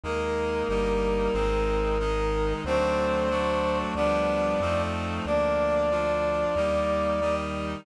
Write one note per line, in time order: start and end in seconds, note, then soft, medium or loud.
0.04 0.64 D#2 loud
0.04 0.68 G#3 medium
0.04 0.68 A#3 medium
0.04 0.68 D#4 medium
0.04 2.53 A#4 medium
0.69 1.29 G1 loud
0.69 1.34 G3 medium
0.69 1.34 A#3 medium
0.69 1.33 D#4 medium
1.33 2.54 G#1 loud
1.33 1.98 G#3 medium
1.33 1.98 C4 medium
1.33 1.98 D#4 medium
1.99 2.64 D#3 medium
1.99 2.64 G#3 medium
1.99 2.64 D#4 medium
2.64 3.84 D2 loud
2.64 3.29 F#3 medium
2.64 3.29 A3 medium
2.64 3.30 C4 loud
2.64 3.29 D4 medium
2.64 3.78 C5 medium
3.30 3.94 F#3 medium
3.30 3.94 A3 medium
3.30 3.94 D4 loud
3.30 3.94 F#4 medium
3.95 4.55 D2 loud
3.95 4.60 F3 medium
3.95 4.60 G3 medium
3.95 4.60 B3 loud
3.95 4.60 D4 medium
3.95 4.82 D5 medium
4.60 5.20 F2 loud
4.60 5.25 F3 loud
4.60 5.25 A3 medium
4.60 5.25 C4 medium
4.60 5.25 D#4 medium
5.25 6.45 D2 loud
5.25 5.90 F3 medium
5.25 5.90 A#3 medium
5.25 5.90 D4 medium
5.25 7.35 D5 medium
5.91 6.55 F3 medium
5.91 6.55 D4 medium
5.91 6.55 F4 medium
6.56 7.76 D#2 loud
6.56 7.20 G3 medium
6.56 7.20 A#3 medium
6.56 7.20 D#4 medium
7.21 7.85 D#3 medium
7.21 7.85 G3 medium
7.21 7.85 D#4 medium